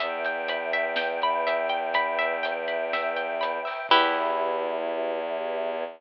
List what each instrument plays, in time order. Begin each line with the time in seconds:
0.00 violin E2, choir aahs B4 E5 G5, orchestral harp E5, kick, closed hi-hat
0.24 orchestral harp G5, closed hi-hat
0.48 orchestral harp B5, closed hi-hat
0.73 orchestral harp E5, closed hi-hat
0.96 orchestral harp G5, snare
1.22 orchestral harp B5, closed hi-hat
1.47 orchestral harp E5, closed hi-hat
1.69 orchestral harp G5, closed hi-hat
1.94 orchestral harp B5, kick, closed hi-hat
2.19 orchestral harp E5, closed hi-hat
2.43 orchestral harp G5, closed hi-hat
2.68 orchestral harp B5, closed hi-hat
2.93 orchestral harp E5, snare
3.16 orchestral harp G5, closed hi-hat
3.41 orchestral harp B5, closed hi-hat
3.65 orchestral harp E5, open hi-hat
3.89 violin E2, choir aahs B3 E4 G4, orchestral harp E4 G4 B4, kick, crash